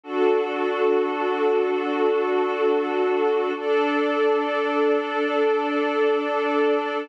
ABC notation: X:1
M:4/4
L:1/8
Q:1/4=68
K:Dmix
V:1 name="Pad 5 (bowed)"
[DFA]8 | [DAd]8 |]